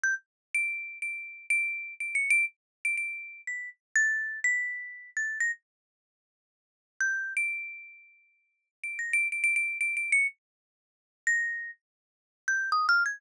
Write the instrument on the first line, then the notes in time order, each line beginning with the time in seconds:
marimba
0.04 G6
0.54 D7
1.02 D7
1.50 D7
2.00 D7
2.15 C#7
2.30 D7
2.85 D7
2.97 D7
3.47 B6
3.96 A6
4.44 B6
5.17 A6
5.40 A#6
7.01 G6
7.37 D7
8.84 D7
8.99 A#6
9.13 D7
9.32 D7
9.44 D7
9.56 D7
9.81 D7
9.97 D7
10.12 C#7
11.27 A#6
12.48 G6
12.72 D#6
12.89 F6
13.06 G#6